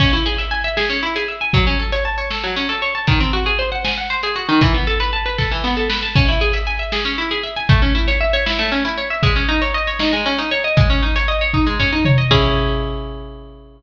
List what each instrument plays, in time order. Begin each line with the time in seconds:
0.00 orchestral harp C#4, kick, crash
0.13 orchestral harp E4
0.26 orchestral harp G#4
0.38 orchestral harp E5, closed hi-hat
0.51 orchestral harp G#5
0.64 orchestral harp E5
0.77 orchestral harp G#4, snare
0.90 orchestral harp C#4
1.03 orchestral harp E4
1.16 orchestral harp G#4, closed hi-hat
1.28 orchestral harp E5
1.41 orchestral harp G#5
1.53 orchestral harp F#3, kick, closed hi-hat
1.67 orchestral harp C#4
1.79 orchestral harp A4
1.92 orchestral harp C#5, closed hi-hat
2.05 orchestral harp A5
2.18 orchestral harp C#5
2.30 orchestral harp A4, snare
2.44 orchestral harp F#3
2.56 orchestral harp C#4
2.69 orchestral harp A4, closed hi-hat
2.82 orchestral harp C#5
2.95 orchestral harp A5
3.07 orchestral harp D#3, kick, closed hi-hat
3.20 orchestral harp C4
3.33 orchestral harp F#4
3.46 orchestral harp G#4, closed hi-hat
3.59 orchestral harp C5
3.72 orchestral harp F#5
3.85 orchestral harp G#5, snare
3.98 orchestral harp F#5
4.10 orchestral harp C5
4.23 orchestral harp G#4, closed hi-hat
4.36 orchestral harp F#4
4.49 orchestral harp D#3
4.61 orchestral harp E3, kick, closed hi-hat
4.74 orchestral harp B3
4.87 orchestral harp A4
5.00 orchestral harp B4, closed hi-hat
5.13 orchestral harp A5
5.26 orchestral harp B4
5.38 orchestral harp A4, kick, snare
5.51 orchestral harp E3
5.64 orchestral harp B3, snare
5.77 orchestral harp A4
5.90 orchestral harp B4, snare
6.03 orchestral harp A5
6.15 orchestral harp C#4, kick, crash
6.28 orchestral harp E4
6.41 orchestral harp G#4
6.53 orchestral harp E5, closed hi-hat
6.67 orchestral harp G#5
6.79 orchestral harp E5
6.92 orchestral harp G#4, snare
7.05 orchestral harp C#4
7.18 orchestral harp E4
7.31 orchestral harp G#4, closed hi-hat
7.43 orchestral harp E5
7.56 orchestral harp G#5
7.69 orchestral harp A3, kick, closed hi-hat
7.82 orchestral harp C#4
7.95 orchestral harp E4
8.08 orchestral harp C#5, closed hi-hat
8.21 orchestral harp E5
8.33 orchestral harp C#5
8.46 orchestral harp E4, snare
8.59 orchestral harp A3
8.72 orchestral harp C#4
8.85 orchestral harp E4, closed hi-hat
8.98 orchestral harp C#5
9.10 orchestral harp E5
9.23 orchestral harp G#3, kick, closed hi-hat
9.36 orchestral harp C#4
9.49 orchestral harp D#4
9.62 orchestral harp C#5, closed hi-hat
9.74 orchestral harp D#5
9.87 orchestral harp C#5
9.99 orchestral harp D#4, snare
10.13 orchestral harp G#3
10.26 orchestral harp C#4
10.38 orchestral harp D#4, closed hi-hat
10.51 orchestral harp C#5
10.64 orchestral harp D#5
10.77 orchestral harp G#3, kick, closed hi-hat
10.90 orchestral harp C#4
11.03 orchestral harp D#4
11.16 orchestral harp C#5, closed hi-hat
11.28 orchestral harp D#5
11.41 orchestral harp C#5
11.54 orchestral harp D#4, kick
11.67 orchestral harp G#3
11.79 orchestral harp C#4, floor tom
11.92 orchestral harp D#4
12.05 orchestral harp C#5, mid tom
12.18 orchestral harp D#5
12.31 orchestral harp C#4 E4 G#4, kick, crash